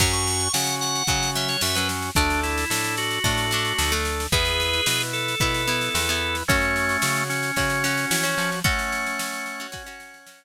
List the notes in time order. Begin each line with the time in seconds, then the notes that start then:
0.00 F#2 F#3 C#4 F#4 C#6, kick, snare, crash
0.13 C#6, snare
0.27 snare
0.40 snare
0.53 C#3 C#4 F#4 F#5, snare
0.67 snare
0.81 F#5, snare
0.95 snare
1.07 C#3 F#3 C#4 F#4, kick, snare
1.23 snare
1.35 F#3 C#4 E5, snare
1.48 C#5, snare
1.61 F#2 C#4 F#4 E5, snare
1.75 F#3 C#4 B4, snare
1.89 snare
2.02 snare
2.15 D2 A3 D4 A4, kick, snare
2.30 snare
2.43 E4, snare
2.58 snare
2.70 A2 D4 A4, snare
2.84 snare
2.97 F#4, snare
3.11 snare
3.24 A2 A3 D4 A4, kick, snare
3.38 snare
3.51 A3 D4, snare
3.65 snare
3.78 D2 D4 A4, snare
3.92 A3 D4, snare
4.05 snare
4.20 snare
4.32 E2 B3 E4 G#4 B4, kick, snare
4.45 snare
4.60 snare
4.73 snare
4.86 B2 E4 B4, snare
5.01 snare
5.13 A4, snare
5.28 snare
5.40 B2 B3 E4 B4, kick, snare
5.54 snare
5.67 B3 E4, snare
5.81 snare
5.94 E2 E4 B4, snare
6.09 B3 E4, snare
6.35 snare
6.48 F#2 A3 C#4 F#4 C#5, kick, snare
6.61 snare
6.76 snare
6.89 snare
7.02 C#3 F#4 C#5, snare
7.16 snare
7.30 C#4, snare
7.43 snare
7.56 C#3 C#4 F#4 C#5, kick, snare
7.70 snare
7.84 C#4 F#4, snare
7.98 snare
8.11 E3 F#4 C#5, snare
8.24 C#4 F#4, snare
8.38 F3, snare
8.52 snare
8.64 A3 C#4 F#4 C#5 F#5, kick, snare
8.79 snare
8.92 snare
9.06 snare
9.19 snare
9.33 snare
9.46 snare
9.60 C#4 F#4, snare
9.72 C#4 F#4, kick, snare
9.86 C#4 F#4, snare
10.00 snare
10.14 snare
10.27 C#4 F#4, snare
10.40 snare